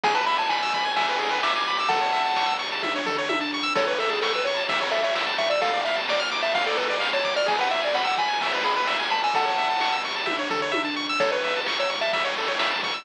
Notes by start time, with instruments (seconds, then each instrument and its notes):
0.03 synth bass 1 G#1, lead 1 (square) G#4 G#5, kick, ride
0.15 lead 1 (square) B4 A5
0.26 synth bass 1 G#1, lead 1 (square) E5 B5, ride
0.38 lead 1 (square) G#5 A5
0.49 synth bass 1 G#1, lead 1 (square) G#5 B5, snare
0.63 lead 1 (square) E6
0.73 synth bass 1 G#1, lead 1 (square) B5, kick, ride
0.85 lead 1 (square) G#5
0.96 synth bass 1 G#1, lead 1 (square) E5 G#5, kick, ride
1.09 lead 1 (square) B4
1.19 synth bass 1 G#1, lead 1 (square) G#4, ride
1.31 lead 1 (square) B4
1.43 synth bass 1 G#1, lead 1 (square) E5 D6, snare
1.53 lead 1 (square) G#5 D6
1.66 synth bass 1 G#1, lead 1 (square) B5 D6, ride
1.78 lead 1 (square) D6 E6
1.89 synth bass 1 A1, lead 1 (square) A4 F#5 A5, kick, ride
2.01 lead 1 (square) C#5
2.13 synth bass 1 A1, lead 1 (square) E5, ride
2.26 lead 1 (square) A5
2.36 synth bass 1 A1, lead 1 (square) C#6, snare
2.46 lead 1 (square) E6
2.59 synth bass 1 A1, lead 1 (square) C#6, ride
2.72 lead 1 (square) A5
2.83 synth bass 1 A1, lead 1 (square) E5, kick, high tom
2.96 lead 1 (square) C#5
3.06 synth bass 1 A1, lead 1 (square) A4, floor tom
3.18 lead 1 (square) C#5
3.29 synth bass 1 A1, lead 1 (square) E5, high tom
3.41 lead 1 (square) A5
3.53 synth bass 1 A1, lead 1 (square) C#6
3.63 lead 1 (square) E6
3.75 synth bass 1 A1, lead 1 (square) A4 C#5, kick, crash
3.87 lead 1 (square) B4 C#5
3.98 synth bass 1 A1, lead 1 (square) A4 E5, ride
4.09 lead 1 (square) G#4 A5
4.22 synth bass 1 A1, lead 1 (square) A4 C#6, snare
4.33 lead 1 (square) B4 E6
4.44 synth bass 1 A1, lead 1 (square) C#5 C#6, ride
4.57 lead 1 (square) A5
4.69 synth bass 1 A1, lead 1 (square) E5, kick, ride
4.81 lead 1 (square) C#5
4.91 synth bass 1 A1, lead 1 (square) A4 E5, ride
5.03 lead 1 (square) C#5 E5
5.15 synth bass 1 A1, lead 1 (square) E5, snare
5.27 lead 1 (square) A5
5.38 synth bass 1 A1, lead 1 (square) E5 C#6, kick, ride
5.50 lead 1 (square) D5 E6
5.61 synth bass 1 D2, lead 1 (square) A4 F5, kick, ride
5.73 lead 1 (square) D5
5.85 synth bass 1 D2, lead 1 (square) E5 F5, ride
5.96 lead 1 (square) A5
6.08 synth bass 1 D2, lead 1 (square) D5 D6, snare
6.20 lead 1 (square) F6
6.31 synth bass 1 D2, lead 1 (square) D6, ride
6.43 lead 1 (square) E5 A5
6.55 synth bass 1 D2, lead 1 (square) F5, kick, ride
6.66 lead 1 (square) A4 D5
6.77 synth bass 1 D2, lead 1 (square) A4 B4, kick, ride
6.90 lead 1 (square) D5
7.00 synth bass 1 D2, lead 1 (square) F5, snare
7.13 lead 1 (square) C#5 A5
7.24 synth bass 1 D2, lead 1 (square) D6, kick, ride
7.36 lead 1 (square) D5 F6
7.46 synth bass 1 G#1, lead 1 (square) G#4 G#5, kick, ride
7.58 lead 1 (square) B4 F#5
7.70 synth bass 1 G#1, lead 1 (square) E5, ride
7.82 lead 1 (square) D5 G#5
7.94 synth bass 1 G#1, lead 1 (square) F#5 B5, snare
8.05 lead 1 (square) F#5 E6
8.18 synth bass 1 G#1, lead 1 (square) G#5 B5, kick, ride
8.28 lead 1 (square) G#5
8.41 synth bass 1 G#1, lead 1 (square) E5, kick, ride
8.54 lead 1 (square) B4
8.64 synth bass 1 G#1, lead 1 (square) G#4 B5, ride
8.76 lead 1 (square) B4 B5
8.87 synth bass 1 G#1, lead 1 (square) E5, snare
8.99 lead 1 (square) G#5
9.10 synth bass 1 G#1, lead 1 (square) A5 B5, ride
9.24 lead 1 (square) G#5 E6
9.34 synth bass 1 A1, lead 1 (square) A4 F#5 A5, kick, ride
9.45 lead 1 (square) C#5
9.57 synth bass 1 A1, lead 1 (square) E5, ride
9.71 lead 1 (square) A5
9.80 synth bass 1 A1, lead 1 (square) C#6, snare
9.92 lead 1 (square) E6
10.04 synth bass 1 A1, lead 1 (square) C#6, ride
10.16 lead 1 (square) A5
10.26 synth bass 1 A1, lead 1 (square) E5, kick, high tom
10.39 lead 1 (square) C#5
10.50 synth bass 1 A1, lead 1 (square) A4, floor tom
10.62 lead 1 (square) C#5
10.72 synth bass 1 A1, lead 1 (square) E5, high tom
10.85 lead 1 (square) A5
10.96 synth bass 1 A1, lead 1 (square) C#6
11.09 lead 1 (square) E6
11.20 synth bass 1 A1, lead 1 (square) A4 C#5, kick, ride
11.32 lead 1 (square) B4 C#5
11.43 synth bass 1 A1, lead 1 (square) E5, ride
11.56 lead 1 (square) A5
11.66 synth bass 1 A1, lead 1 (square) C#6, snare
11.79 lead 1 (square) C#5 E6
11.90 synth bass 1 A1, lead 1 (square) C#6, ride
12.01 lead 1 (square) E5 A5
12.13 synth bass 1 A1, lead 1 (square) E5, kick, ride
12.25 lead 1 (square) C#5
12.36 synth bass 1 A1, lead 1 (square) A4, ride
12.48 lead 1 (square) C#5
12.59 synth bass 1 A1, lead 1 (square) E5, snare
12.71 lead 1 (square) A5
12.83 synth bass 1 A1, lead 1 (square) C#6, kick, ride
12.94 lead 1 (square) E6